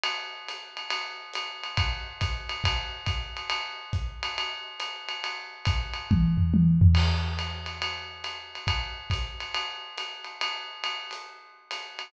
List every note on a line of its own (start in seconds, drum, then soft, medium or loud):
0.04 ride loud
0.48 hi-hat pedal medium
0.48 ride medium
0.77 ride medium
0.90 ride loud
1.33 hi-hat pedal medium
1.33 ride medium
1.63 ride medium
1.77 kick medium
1.77 ride loud
2.21 kick medium
2.21 hi-hat pedal medium
2.21 ride medium
2.49 ride medium
2.64 kick medium
2.64 ride loud
3.06 kick medium
3.06 hi-hat pedal medium
3.06 ride medium
3.37 ride medium
3.50 ride loud
3.93 kick medium
3.93 hi-hat pedal medium
4.23 ride medium
4.38 ride medium
4.80 hi-hat pedal medium
4.80 ride medium
5.09 ride medium
5.24 ride medium
5.65 kick medium
5.65 hi-hat pedal medium
5.65 ride medium
5.94 ride medium
6.11 kick medium
6.11 high tom medium
6.37 floor tom medium
6.54 high tom medium
6.81 floor tom loud
6.95 crash loud
6.95 ride medium
7.39 hi-hat pedal medium
7.39 ride medium
7.66 ride medium
7.82 ride medium
8.24 hi-hat pedal medium
8.24 ride medium
8.55 ride medium
8.67 kick medium
8.67 ride loud
9.10 kick medium
9.10 hi-hat pedal medium
9.10 ride medium
9.40 ride medium
9.54 ride medium
9.98 hi-hat pedal medium
9.98 ride medium
10.24 ride medium
10.41 ride loud
10.84 ride medium
11.11 hi-hat pedal medium
11.11 ride medium
11.71 hi-hat pedal medium
11.71 ride medium
11.99 ride medium